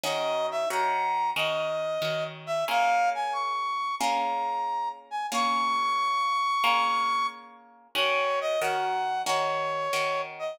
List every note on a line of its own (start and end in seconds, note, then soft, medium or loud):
0.04 0.66 D#3 loud
0.04 0.66 C#4 loud
0.04 0.66 F#4 loud
0.04 0.66 A#4 loud
0.04 0.47 D#5 medium
0.51 0.69 E5 medium
0.70 1.32 D#3 loud
0.70 1.32 C#4 loud
0.70 1.32 F#4 loud
0.70 1.32 A#4 loud
0.70 1.30 A#5 medium
1.36 1.98 D#3 loud
1.36 1.98 C#4 loud
1.36 1.98 F#4 loud
1.36 1.98 A#4 loud
1.36 2.24 D#5 medium
2.02 2.64 D#3 loud
2.02 2.64 C#4 loud
2.02 2.64 F#4 medium
2.02 2.64 A#4 loud
2.47 2.65 E5 medium
2.68 3.92 A#3 loud
2.68 3.92 C#4 loud
2.68 3.92 F4 loud
2.68 3.92 G#4 loud
2.68 3.10 F5 loud
3.15 3.34 G#5 medium
3.33 3.95 C#6 medium
3.99 5.24 A#3 loud
3.99 5.24 C#4 loud
3.99 5.24 F4 loud
3.99 5.24 G#4 loud
3.99 4.89 A#5 medium
5.11 5.27 G#5 medium
5.32 6.56 A#3 loud
5.32 6.56 C#4 loud
5.32 6.56 F4 loud
5.32 6.56 G#4 loud
5.32 7.27 C#6 loud
6.64 7.88 A#3 loud
6.64 7.88 C#4 loud
6.64 7.88 F4 loud
6.64 7.88 G#4 loud
7.95 8.57 D#3 loud
7.95 8.57 C#4 loud
7.95 8.57 F#4 loud
7.95 8.57 A#4 loud
7.95 8.39 C#5 medium
8.41 8.60 D#5 loud
8.61 9.23 D#3 loud
8.61 9.23 C#4 loud
8.61 9.23 F#4 loud
8.61 9.23 A#4 medium
8.61 9.22 F#5 medium
9.26 9.88 D#3 loud
9.26 9.88 C#4 loud
9.26 9.88 F#4 loud
9.26 9.88 A#4 loud
9.26 10.22 C#5 medium
9.93 10.55 D#3 loud
9.93 10.55 C#4 medium
9.93 10.55 F#4 medium
9.93 10.55 A#4 loud
10.39 10.59 D#5 medium